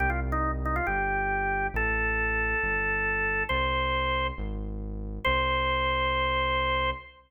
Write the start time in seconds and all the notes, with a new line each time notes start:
0.00 C2 G4
0.10 F4
0.32 D#4
0.65 D#4
0.76 F4
0.87 G1 G4
1.74 A1 A4
2.63 G1
3.49 C2 C5
4.38 G#1
5.25 C2 C5